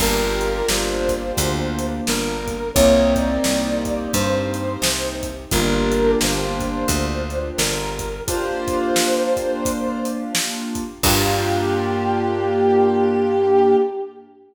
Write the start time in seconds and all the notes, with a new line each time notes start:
0.00 G1 A#3 D4 F4 G4 A#4, kick, crash
0.41 closed hi-hat
0.68 G1 C5, snare
1.09 kick, closed hi-hat
1.37 D2, kick, closed hi-hat
1.79 closed hi-hat
2.07 G1 A#4, snare
2.48 kick, closed hi-hat
2.74 C2 A#3 C4 D#4 G4 C#5, kick, closed hi-hat
3.16 D5, kick, closed hi-hat
3.44 C2, snare
3.85 kick, closed hi-hat
4.13 G2 C5, kick, closed hi-hat
4.54 closed hi-hat
4.82 C2, snare
5.23 kick, closed hi-hat
5.51 G1 A#3 D4 F4 G4 A#4, kick, closed hi-hat
5.92 closed hi-hat
6.21 G1 C5, snare
6.60 kick, closed hi-hat
6.88 D2, kick, closed hi-hat
7.30 closed hi-hat
7.57 G1 A#4, snare
7.99 kick, closed hi-hat
8.28 A#3 D4 F4 G4 C5, kick, closed hi-hat
8.68 kick, closed hi-hat
8.96 snare
9.37 kick, closed hi-hat
9.65 kick, closed hi-hat
10.05 closed hi-hat
10.35 snare
10.75 kick, closed hi-hat
11.03 G2 A#3 D4 F4 G4, kick, crash